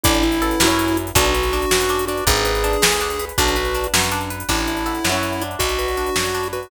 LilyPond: <<
  \new Staff \with { instrumentName = "Lead 1 (square)" } { \time 6/8 \key a \major \tempo 4. = 108 e'2. | fis'2~ fis'8 fis'8 | gis'2. | fis'4. r4. |
e'2. | fis'2~ fis'8 fis'8 | }
  \new Staff \with { instrumentName = "Acoustic Grand Piano" } { \time 6/8 \key a \major <d' e' a'>4 <cis' e' fis' b'>2 | <d' fis' b'>4. <d' fis' b'>4. | <d' gis' b'>4. <d' gis' b'>4. | <d' fis' b'>4. <d' fis' b'>4. |
<d'' e'' a''>4 <cis'' e'' fis'' b''>2 | <d'' fis'' b''>4. <d'' fis'' b''>4. | }
  \new Staff \with { instrumentName = "Pizzicato Strings" } { \time 6/8 \key a \major d'8 e'8 a'8 <cis' e' fis' b'>4. | d'8 b'8 d'8 fis'8 d'8 d'8~ | d'8 b'8 d'8 gis'8 d'8 b'8 | d'8 b'8 d'8 fis'8 d'8 b'8 |
d'8 e'8 a'8 <cis' e' fis' b'>4 d'8~ | d'8 b'8 d'8 fis'8 d'8 b'8 | }
  \new Staff \with { instrumentName = "Electric Bass (finger)" } { \clef bass \time 6/8 \key a \major a,,4. fis,4. | b,,4. fis,4. | gis,,4. d,4. | b,,4. fis,4. |
a,,4. fis,4. | b,,4. fis,4. | }
  \new DrumStaff \with { instrumentName = "Drums" } \drummode { \time 6/8 <hh bd>16 hh16 hh16 hh16 hh16 hh16 sn16 hh16 hh16 hh16 hh16 hh16 | <hh bd>16 hh16 hh16 hh16 hh16 hh16 sn16 hh16 hh16 hh16 hh16 hh16 | <hh bd>16 hh16 hh16 hh16 hh16 hh16 sn16 hh16 hh16 hh16 hh16 hh16 | <hh bd>16 hh16 hh16 hh16 hh16 hh16 sn16 hh16 hh16 hh16 hh16 hh16 |
<cymc bd>16 hh16 hh16 hh16 hh16 hh16 sn16 hh16 hh16 hh16 hh16 hh16 | <hh bd>16 hh16 hh16 hh16 hh16 hh16 sn16 hh16 hh16 hh16 hh16 hh16 | }
>>